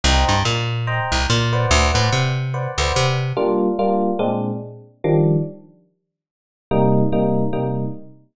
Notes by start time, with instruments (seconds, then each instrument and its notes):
0.04 electric bass (finger) C2, electric piano 1 C5 D#5 G5 A#5
0.28 electric bass (finger) G2
0.45 electric bass (finger) A#2
0.87 electric piano 1 C5 D#5 G5 A#5
1.12 electric bass (finger) C2
1.30 electric bass (finger) A#2
1.53 electric piano 1 B4 C5 D5 F#5
1.71 electric bass (finger) D2
1.94 electric bass (finger) A2, electric piano 1 B4 C5 D5 F#5
2.12 electric bass (finger) C3
2.54 electric piano 1 B4 C5 D5 F#5
2.78 electric bass (finger) D2, electric piano 1 B4 C5 D5 F#5
2.96 electric bass (finger) C3
3.37 electric piano 1 G3 A#3 D4 F4
3.79 electric piano 1 G3 A#3 D4 F4
4.19 electric piano 1 A#2 G#3 C4 D4
5.04 electric piano 1 D#3 F3 G3 D4
6.71 electric piano 1 C3 G3 A#3 D#4
7.12 electric piano 1 C3 G3 A#3 D#4
7.53 electric piano 1 C3 G3 A#3 D#4